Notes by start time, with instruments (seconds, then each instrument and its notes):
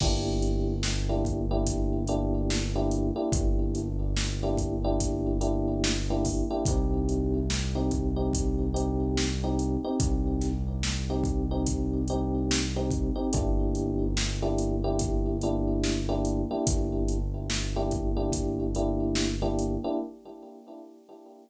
0.00 synth bass 1 G1, electric piano 1 A#3 D4 E4 G4, kick, crash
0.42 closed hi-hat
0.83 snare
1.09 electric piano 1 A#3 D4 E4 G4
1.25 kick, closed hi-hat
1.51 electric piano 1 A#3 D4 E4 G4
1.66 kick, closed hi-hat
2.07 electric piano 1 A#3 D4 E4 G4, closed hi-hat
2.50 snare
2.76 electric piano 1 A#3 D4 E4 G4
2.91 closed hi-hat
3.16 electric piano 1 A#3 D4 E4 G4
3.32 synth bass 1 G1, kick, closed hi-hat
3.75 closed hi-hat
4.16 snare
4.43 electric piano 1 A#3 D4 E4 G4
4.57 kick, closed hi-hat
4.84 electric piano 1 A#3 D4 E4 G4
5.00 kick, closed hi-hat
5.41 electric piano 1 A#3 D4 E4 G4, closed hi-hat
5.84 snare
6.10 electric piano 1 A#3 D4 E4 G4
6.25 kick, open hi-hat
6.51 electric piano 1 A#3 D4 E4 G4
6.65 synth bass 1 C2, electric piano 1 C4 D#4 G4, kick, closed hi-hat
7.09 closed hi-hat
7.50 snare
7.75 electric piano 1 C4 D#4 G4
7.91 kick, closed hi-hat
8.16 electric piano 1 C4 D#4 G4
8.33 kick, closed hi-hat
8.74 electric piano 1 C4 D#4 G4, closed hi-hat
9.17 snare
9.44 electric piano 1 C4 D#4 G4
9.59 closed hi-hat
9.84 electric piano 1 C4 D#4 G4
10.00 synth bass 1 C2, kick, closed hi-hat
10.41 snare, closed hi-hat
10.83 snare
11.10 electric piano 1 C4 D#4 G4
11.24 kick, closed hi-hat
11.51 electric piano 1 C4 D#4 G4
11.66 kick, closed hi-hat
12.08 electric piano 1 C4 D#4 G4, closed hi-hat
12.51 snare
12.76 electric piano 1 C4 D#4 G4
12.91 kick, closed hi-hat
13.16 electric piano 1 C4 D#4 G4
13.33 synth bass 1 G1, electric piano 1 A#3 D4 E4 G4, kick, closed hi-hat
13.75 closed hi-hat
14.17 snare
14.42 electric piano 1 A#3 D4 E4 G4
14.58 closed hi-hat
14.84 electric piano 1 A#3 D4 E4 G4
14.99 kick, closed hi-hat
15.41 electric piano 1 A#3 D4 E4 G4, closed hi-hat
15.84 snare
16.09 electric piano 1 A#3 D4 E4 G4
16.25 closed hi-hat
16.51 electric piano 1 A#3 D4 E4 G4
16.67 synth bass 1 G1, kick, closed hi-hat
17.08 closed hi-hat
17.50 snare
17.76 electric piano 1 A#3 D4 E4 G4
17.91 kick, closed hi-hat
18.17 electric piano 1 A#3 D4 E4 G4
18.32 kick, closed hi-hat
18.75 electric piano 1 A#3 D4 E4 G4, closed hi-hat
19.15 snare
19.42 electric piano 1 A#3 D4 E4 G4
19.59 closed hi-hat
19.84 electric piano 1 A#3 D4 E4 G4